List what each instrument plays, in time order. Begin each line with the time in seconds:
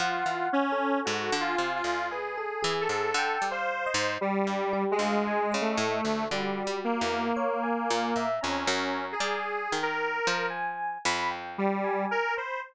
0.00 orchestral harp F3, lead 1 (square) F4, electric piano 1 F#5
0.26 orchestral harp E3
0.53 lead 1 (square) C#4
0.72 electric piano 1 A4
1.05 orchestral harp G#2, lead 1 (square) F#4
1.32 orchestral harp D3
1.40 lead 1 (square) F4, electric piano 1 G#5
1.58 orchestral harp C3
1.75 lead 1 (square) F4
1.84 orchestral harp D2
2.11 lead 1 (square) G#4, electric piano 1 B4
2.38 electric piano 1 A4
2.63 orchestral harp E3, electric piano 1 G#4
2.81 lead 1 (square) A4
2.89 orchestral harp G#2
3.14 orchestral harp D3, electric piano 1 G5
3.42 orchestral harp G3
3.51 lead 1 (square) C5, electric piano 1 F5
3.86 electric piano 1 D#5
3.94 orchestral harp G#2
4.21 lead 1 (square) G3
4.47 orchestral harp G2
4.73 electric piano 1 G4
4.91 lead 1 (square) G#3
4.99 orchestral harp D2, electric piano 1 F5
5.27 electric piano 1 G#5
5.52 orchestral harp C#3, electric piano 1 D#5
5.61 lead 1 (square) A3
5.77 orchestral harp A2
6.05 orchestral harp D2
6.30 orchestral harp D3, lead 1 (square) G3, electric piano 1 F#4
6.67 orchestral harp G3
6.84 lead 1 (square) A#3
7.01 orchestral harp E2
7.37 electric piano 1 C#5
7.63 electric piano 1 G#5
7.90 orchestral harp A#2
8.16 orchestral harp A#2, electric piano 1 E5
8.41 orchestral harp F2, lead 1 (square) C#4, electric piano 1 A#5
8.67 orchestral harp F#2
9.12 lead 1 (square) G#4
9.20 orchestral harp G3
9.72 orchestral harp D#3
9.83 lead 1 (square) A#4
10.27 orchestral harp F3
10.50 electric piano 1 G#5
11.05 orchestral harp F2, electric piano 1 B5
11.31 electric piano 1 G5
11.58 lead 1 (square) G3
11.84 electric piano 1 G#5
12.11 lead 1 (square) A#4
12.37 lead 1 (square) C5, electric piano 1 B5